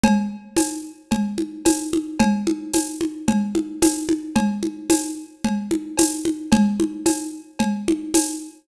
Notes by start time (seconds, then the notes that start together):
0.03 cowbell, low conga
0.57 tambourine, cowbell, high conga
1.11 cowbell, low conga
1.38 high conga
1.65 tambourine, cowbell, high conga
1.93 high conga
2.19 cowbell, low conga
2.47 high conga
2.74 tambourine, cowbell, high conga
3.01 high conga
3.28 cowbell, low conga
3.55 high conga
3.82 tambourine, cowbell, high conga
4.09 high conga
4.36 cowbell, low conga
4.63 high conga
4.90 tambourine, cowbell, high conga
5.44 cowbell, low conga
5.71 high conga
5.97 tambourine, cowbell, high conga
6.25 high conga
6.52 cowbell, low conga
6.80 high conga
7.06 tambourine, cowbell, high conga
7.59 cowbell, low conga
7.88 high conga
8.14 tambourine, cowbell, high conga